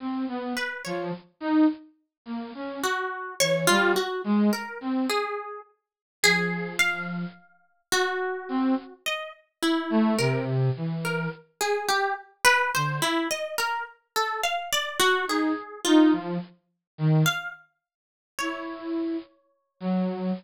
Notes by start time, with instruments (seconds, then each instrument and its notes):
0.00 flute C4
0.28 flute B3
0.57 orchestral harp B4
0.85 flute F3, orchestral harp C#5
1.40 flute D#4
2.25 flute A#3
2.54 flute C#4
2.83 orchestral harp F#4
3.40 flute E3, orchestral harp C#5
3.67 flute G3, orchestral harp F4
3.96 orchestral harp F#4
4.24 flute G#3
4.53 orchestral harp A#4
4.81 flute C4
5.09 orchestral harp G#4
6.23 flute F3, orchestral harp G#4
6.79 orchestral harp F5
7.92 orchestral harp F#4
8.49 flute C4
9.06 orchestral harp D#5
9.62 orchestral harp E4
9.90 flute A3
10.18 flute C3, orchestral harp A#4
10.76 flute E3
11.05 orchestral harp A#4
11.61 orchestral harp G#4
11.88 orchestral harp G4
12.45 orchestral harp B4
12.74 flute D3, orchestral harp C5
13.02 orchestral harp E4
13.31 orchestral harp D#5
13.58 orchestral harp A#4
14.16 orchestral harp A4
14.43 orchestral harp F5
14.73 orchestral harp D5
15.00 orchestral harp F#4
15.27 flute D#4, orchestral harp G#4
15.85 flute D#4, orchestral harp F4
16.12 flute F3
16.98 flute D#3
17.26 orchestral harp F5
18.39 flute E4, orchestral harp C#5
19.80 flute F#3